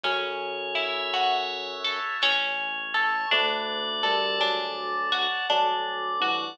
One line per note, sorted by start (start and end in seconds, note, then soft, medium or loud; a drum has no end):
0.03 2.00 F#2 loud
0.03 1.72 F#3 medium
0.03 2.15 C#4 loud
0.03 2.15 C#5 loud
0.03 kick loud
0.03 snare medium
0.75 2.16 E4 medium
0.75 2.17 E5 loud
0.75 snare medium
1.13 2.19 F#4 medium
1.13 2.19 F#5 medium
1.13 snare medium
1.84 2.20 A4 medium
1.84 2.22 A5 medium
1.84 snare medium
2.22 3.25 A1 loud
2.22 3.28 C#4 loud
2.22 3.27 C#5 loud
2.22 snare medium
2.94 3.30 A4 loud
2.94 3.30 A5 loud
2.94 snare medium
3.31 5.27 D2 loud
3.31 3.91 A3 medium
3.31 4.40 D4 loud
3.31 4.41 D5 loud
3.31 kick medium
3.31 snare medium
4.03 4.36 G3 medium
4.03 5.44 A4 medium
4.03 5.45 A5 loud
4.03 snare medium
4.39 5.02 F#3 medium
4.39 5.46 D4 medium
4.39 5.46 D5 loud
4.39 snare medium
5.12 5.48 F#4 medium
5.12 5.47 F#5 medium
5.12 snare medium
5.49 6.53 D2 loud
5.49 6.10 F#3 medium
5.49 6.55 D4 loud
5.49 6.57 D5 loud
5.49 kick medium
5.49 high tom medium
6.20 6.54 E3 medium
6.20 6.57 F#4 medium
6.20 6.57 F#5 medium
6.20 high tom medium